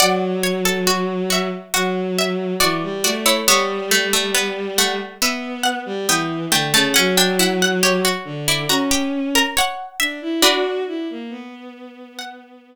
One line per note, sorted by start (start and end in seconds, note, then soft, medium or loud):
0.00 1.48 F#3 medium
0.00 0.41 D5 loud
0.00 1.09 D5 medium
0.00 1.09 F#5 medium
0.43 0.64 C#5 medium
0.65 0.86 A4 medium
0.87 1.22 F#4 loud
1.30 1.69 F#4 medium
1.30 1.75 E5 medium
1.74 2.54 F#3 medium
1.74 2.46 F#4 loud
1.74 2.14 F#5 medium
2.18 2.55 E5 medium
2.60 2.81 E3 medium
2.60 2.99 F#4 loud
2.60 3.00 D5 medium
2.83 3.03 G3 medium
3.04 3.41 A3 medium
3.04 3.25 F#4 loud
3.04 3.25 D5 medium
3.26 3.47 E4 loud
3.26 3.46 C#5 medium
3.46 4.97 G3 medium
3.46 3.89 B3 loud
3.46 4.73 C#5 medium
3.46 4.73 E5 medium
3.91 4.12 A3 loud
4.13 4.34 A3 medium
4.34 4.73 B3 loud
4.78 5.14 A3 loud
4.78 5.18 F#5 medium
5.21 5.79 B3 medium
5.21 5.93 B3 medium
5.21 5.63 E5 medium
5.63 6.00 F#5 medium
5.86 6.06 G3 medium
6.08 6.46 E3 medium
6.08 6.48 B3 loud
6.08 6.51 G5 medium
6.51 6.71 D3 medium
6.51 6.72 A3 loud
6.51 6.73 G5 medium
6.73 6.94 C#3 medium
6.73 6.94 A3 loud
6.73 6.95 A5 medium
6.94 8.06 F#3 medium
6.94 7.16 C#4 loud
6.94 7.15 F#5 medium
7.17 7.38 D4 loud
7.17 7.38 G5 medium
7.39 7.80 E4 loud
7.39 7.61 F#5 medium
7.62 7.83 F#5 medium
7.83 8.04 G4 medium
7.83 8.37 C#5 medium
8.05 8.41 F#4 medium
8.25 8.65 D3 medium
8.48 8.69 E4 loud
8.48 8.70 D5 medium
8.69 9.42 C#4 medium
8.69 8.90 F#4 medium
8.69 9.09 A#5 medium
8.91 9.28 G4 loud
9.35 9.56 A#4 loud
9.35 9.56 A#5 medium
9.57 9.96 C#5 loud
9.57 10.35 F#5 medium
10.00 10.20 D4 medium
10.00 10.40 E5 loud
10.22 10.42 E4 medium
10.42 11.86 D4 medium
10.42 11.86 F#4 medium
10.42 10.82 F#4 medium
10.42 12.20 B4 loud
10.87 11.08 E4 medium
11.10 11.31 A#3 medium
11.30 12.75 B3 medium
12.19 12.75 F#5 medium